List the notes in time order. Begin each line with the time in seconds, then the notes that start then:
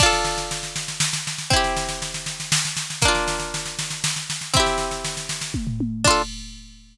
0.00 D4 F4, kick, snare, crash
0.06 A4
0.13 snare
0.25 snare
0.38 snare
0.51 snare
0.63 snare
0.76 snare
0.88 snare
1.00 snare
1.13 snare
1.27 snare
1.38 snare
1.50 C4 E4, kick, snare
1.56 G4
1.64 snare
1.77 snare
1.89 snare
2.02 snare
2.14 snare
2.26 snare
2.40 snare
2.52 snare
2.65 snare
2.77 snare
2.90 snare
3.02 A#3 D4, kick, snare
3.08 F4
3.15 snare
3.28 snare
3.40 snare
3.54 snare
3.66 snare
3.79 snare
3.90 snare
4.04 snare
4.16 snare
4.30 snare
4.41 snare
4.54 C4 E4, kick, snare
4.60 G4
4.66 snare
4.78 snare
4.91 snare
5.05 snare
5.17 snare
5.29 snare
5.41 snare
5.54 kick, high tom
5.67 floor tom
5.80 high tom
6.04 D4 F4, kick, crash
6.11 A4